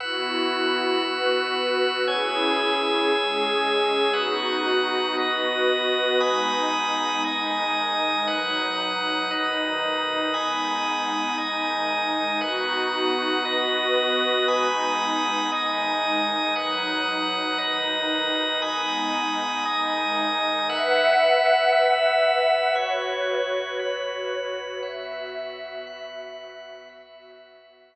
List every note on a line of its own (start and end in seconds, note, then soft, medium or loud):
0.00 1.02 B3 medium
0.00 1.02 E4 medium
0.00 1.02 F#4 medium
0.00 2.05 B4 medium
0.00 2.05 F#5 medium
0.00 2.05 E6 medium
1.04 2.06 B3 medium
1.04 2.06 F#4 medium
1.04 2.06 B4 medium
2.07 3.10 C#4 medium
2.07 3.10 E4 medium
2.07 3.10 G#4 medium
2.07 4.12 C#5 medium
2.07 4.12 G#5 medium
2.07 4.12 E6 medium
3.11 4.14 G#3 medium
3.11 4.14 C#4 medium
3.11 4.14 G#4 medium
4.13 5.16 B3 medium
4.13 5.16 D#4 medium
4.13 5.16 F#4 medium
4.13 5.16 B4 medium
4.13 5.16 F#5 medium
4.13 5.16 D#6 medium
5.17 6.19 B3 medium
5.17 6.20 F#4 medium
5.17 6.20 B4 medium
5.17 6.20 D#5 medium
5.17 6.20 D#6 medium
6.20 7.22 G#3 medium
6.20 7.22 B3 medium
6.20 7.22 D#4 medium
6.20 7.23 G#5 medium
6.20 7.23 B5 medium
6.20 7.23 D#6 medium
7.24 8.27 D#3 medium
7.24 8.27 G#3 medium
7.24 8.27 D#4 medium
7.24 8.27 D#5 medium
7.24 8.27 G#5 medium
7.24 8.27 D#6 medium
8.27 9.30 B2 medium
8.27 9.30 F#3 medium
8.27 9.30 D#4 medium
8.27 9.30 B4 medium
8.27 9.30 F#5 medium
8.27 9.30 D#6 medium
9.31 10.33 B2 medium
9.31 10.33 D#3 medium
9.31 10.33 D#4 medium
9.31 10.33 B4 medium
9.31 10.33 D#5 medium
9.31 10.33 D#6 medium
10.34 11.37 G#3 medium
10.34 11.37 B3 medium
10.34 11.37 D#4 medium
10.34 11.36 G#5 medium
10.34 11.36 B5 medium
10.34 11.36 D#6 medium
11.38 12.41 D#3 medium
11.38 12.41 G#3 medium
11.38 12.41 D#4 medium
11.38 12.40 D#5 medium
11.38 12.40 G#5 medium
11.38 12.40 D#6 medium
12.41 13.43 B3 medium
12.41 13.45 D#4 medium
12.41 13.43 F#4 medium
12.41 13.43 B4 medium
12.41 13.43 F#5 medium
12.41 13.43 D#6 medium
13.44 14.46 B3 medium
13.44 14.46 F#4 medium
13.44 14.46 B4 medium
13.44 14.47 B4 medium
13.44 14.47 D#5 medium
13.44 14.47 D#6 medium
14.48 15.50 G#3 medium
14.48 15.50 B3 medium
14.48 15.50 D#4 medium
14.48 15.50 G#5 medium
14.48 15.50 B5 medium
14.48 15.50 D#6 medium
15.52 16.54 D#3 medium
15.52 16.54 G#3 medium
15.52 16.54 D#4 medium
15.52 16.54 D#5 medium
15.52 16.54 G#5 medium
15.52 16.54 D#6 medium
16.56 17.58 B2 medium
16.56 17.59 F#3 medium
16.56 17.58 D#4 medium
16.56 17.58 B4 medium
16.56 17.58 F#5 medium
16.56 17.58 D#6 medium
17.58 18.61 B2 medium
17.58 18.61 D#3 medium
17.58 18.61 D#4 medium
17.58 18.60 B4 medium
17.58 18.60 D#5 medium
17.58 18.60 D#6 medium
18.62 19.64 G#3 medium
18.62 19.64 B3 medium
18.62 19.64 D#4 medium
18.62 19.64 G#5 medium
18.62 19.64 B5 medium
18.62 19.64 D#6 medium
19.65 20.68 D#3 medium
19.65 20.68 G#3 medium
19.65 20.68 D#4 medium
19.65 20.68 D#5 medium
19.65 20.68 G#5 medium
19.65 20.68 D#6 medium
20.69 22.74 B4 medium
20.69 21.72 B4 medium
20.69 22.74 E5 medium
20.69 22.74 F#5 medium
20.69 21.72 F#5 medium
20.69 21.72 E6 medium
21.72 22.75 B4 medium
21.72 22.75 E5 medium
21.72 22.75 E6 medium
22.75 23.78 F#4 medium
22.75 24.80 F#4 medium
22.75 24.80 B4 medium
22.75 23.78 C#5 medium
22.75 24.80 C#5 medium
22.75 23.78 B5 medium
23.79 24.82 F#4 medium
23.79 24.82 B4 medium
23.79 24.82 B5 medium
24.83 26.88 B3 medium
24.83 26.88 F#4 medium
24.83 25.85 B4 medium
24.83 25.85 E5 medium
24.83 26.88 E5 medium
24.83 25.85 F#5 medium
25.87 26.89 B4 medium
25.87 26.89 F#5 medium
25.87 26.89 B5 medium
26.89 27.95 B3 medium
26.89 27.95 F#4 medium
26.89 27.92 B4 medium
26.89 27.92 E5 medium
26.89 27.95 E5 medium
26.89 27.92 F#5 medium
27.93 27.95 B4 medium
27.93 27.95 F#5 medium
27.93 27.95 B5 medium